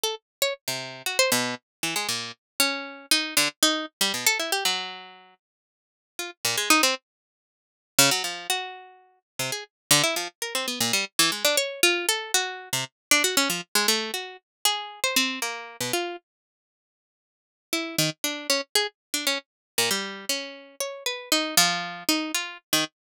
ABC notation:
X:1
M:9/8
L:1/16
Q:3/8=78
K:none
V:1 name="Pizzicato Strings"
A z2 _d z C,3 _G c B,,2 z2 E, _A, _B,,2 | z2 _D4 _E2 =D, z E2 z G, B,, A =E G | _G,6 z6 F z _B,, _A, _E C | z8 _D, _G, F,2 _G6 |
z C, _A z2 D, E F, z _B C =B, _B,, G, z E, _A, D | _d2 F2 A2 _G3 C, z2 =D G _D F, z _A, | A,2 _G2 z2 _A3 c C2 _B,3 =B,, F2 | z12 E2 _E, z D2 |
_D z _A z2 =D _D z3 _B,, G,3 D4 | _d2 B2 _E2 F,4 E2 F2 z _E, z2 |]